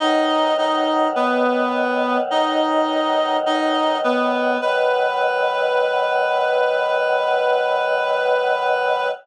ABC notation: X:1
M:4/4
L:1/8
Q:1/4=52
K:B
V:1 name="Clarinet"
[Dd] [Dd] [B,B]2 [Dd]2 [Dd] [B,B] | B8 |]
V:2 name="Choir Aahs" clef=bass
[B,,D,F,]8 | [B,,D,F,]8 |]